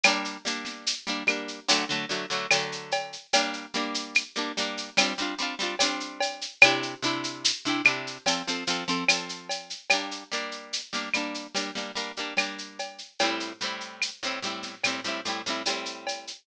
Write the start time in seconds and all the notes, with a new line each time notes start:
0.04 G3 A#3 D4, cowbell, claves, shaker
0.25 shaker
0.45 G3 A#3 D4, shaker
0.65 snare, shaker
0.87 shaker
1.07 G3 A#3 D4, shaker
1.27 G3 A#3 D4, claves, shaker
1.48 shaker
1.68 D3 F#3 A3, cowbell, shaker
1.89 D3 F#3 A3, shaker
2.09 D3 F#3 A3, shaker
2.30 D3 F#3 A3, shaker
2.51 D3 F#3 A3, cowbell, claves, shaker
2.72 shaker
2.92 cowbell, shaker
3.13 shaker
3.33 G3 A#3 D4, cowbell, shaker
3.53 shaker
3.74 G3 A#3 D4, snare, shaker
3.95 shaker
4.15 claves, shaker
4.35 G3 A#3 D4, shaker
4.57 G3 A#3 D4, shaker
4.77 shaker
4.97 G3 C4 D4 F4, cowbell, claves, shaker
5.18 G3 C4 D4, shaker
5.22 F4
5.38 G3 C4 D4, shaker
5.43 F4
5.59 G3 C4 D4 F4, shaker
5.79 G3 C4 D4, cowbell, shaker
5.84 F4
6.00 shaker
6.21 cowbell, shaker
6.41 shaker
6.61 C3 D4 E4, cowbell, claves, shaker
6.66 G4
6.83 shaker
7.03 C3 D4 E4 G4, shaker
7.24 shaker
7.45 shaker
7.65 C3 D4 E4 G4, shaker
7.85 C3 D4 E4, claves, shaker
7.89 G4
8.07 shaker
8.26 F3 C4 A4, cowbell, shaker
8.48 F3 C4 A4, shaker
8.67 F3 C4 A4, shaker
8.88 F3 C4 A4, shaker
9.08 F3 C4 A4, cowbell, claves, shaker
9.29 shaker
9.49 cowbell, shaker
9.70 shaker
9.90 G3 A#3 D4, cowbell, claves, shaker
10.11 shaker
10.32 G3 A#3 D4, shaker
10.52 shaker
10.73 shaker
10.93 G3 A#3 D4, snare, shaker
11.14 G3 A#3 D4, claves, shaker
11.34 shaker
11.55 G3 A#3 D4, cowbell, shaker
11.75 G3 A#3 D4, snare, shaker
11.96 G3 A#3 D4, shaker
12.17 G3 A#3 D4, shaker
12.37 G3 A#3 D4, cowbell, claves, shaker
12.58 shaker
12.79 cowbell, shaker
12.98 shaker
13.19 A2 G3 C4, cowbell, shaker
13.24 E4
13.40 shaker
13.61 A2 G3 C4, shaker
13.65 E4
13.81 shaker
14.02 claves, shaker
14.23 A2 G3 C4 E4, shaker
14.42 A2 G3 C4, shaker
14.47 E4
14.63 snare, shaker
14.84 A2 G3 C4, cowbell, claves, shaker
14.88 E4
15.04 A2 G3 C4, shaker
15.08 E4
15.25 A2 G3 C4, shaker
15.29 E4
15.46 A2 G3 C4, shaker
15.50 E4
15.66 A2 G3 C4, cowbell, shaker
15.70 E4
15.86 shaker
16.07 cowbell, shaker
16.27 shaker